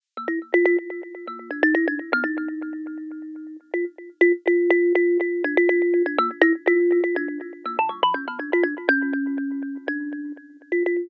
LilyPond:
\new Staff { \time 9/8 \tempo 4. = 81 r16 bes16 e'16 r16 f'16 f'16 r4 bes8 d'16 ees'16 e'16 d'16 r16 b16 | ees'2. f'16 r8. f'16 r16 | f'8 f'8 f'8 f'8 d'16 f'16 f'8. d'16 bes16 r16 e'16 r16 | f'8. f'16 d'8 r8 bes16 ees16 g16 f16 des'16 b16 d'16 f'16 d'16 r16 |
des'2 d'4 r8. f'16 f'8 | }